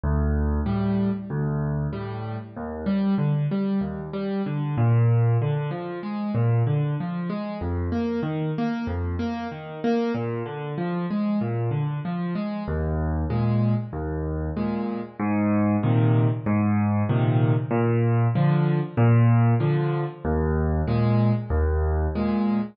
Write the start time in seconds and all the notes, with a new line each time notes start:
0.03 D2
0.66 A2 G3
1.30 D2
1.93 A2 G3
2.56 D#2
2.86 G3
3.18 D3
3.51 G3
3.81 D#2
4.13 G3
4.46 D3
4.77 A#2
5.41 D3
5.71 F3
6.03 G#3
6.35 A#2
6.67 D3
7.00 F3
7.29 G#3
7.61 F2
7.92 A#3
8.23 D#3
8.58 A#3
8.87 F2
9.19 A#3
9.52 D#3
9.84 A#3
10.14 A#2
10.46 D3
10.78 F3
11.11 G#3
11.41 A#2
11.71 D3
12.05 F3
12.35 G#3
12.68 D#2
13.30 A#2 G#3
13.93 D#2
14.57 A#2 G#3
15.19 G#2
15.83 A#2 C3 D#3
16.46 G#2
17.09 A#2 C3 D#3
17.71 A#2
18.35 D3 F3
18.97 A#2
19.60 D3 F3
20.25 D#2
20.87 A#2 G#3
21.50 D#2
22.15 A#2 G#3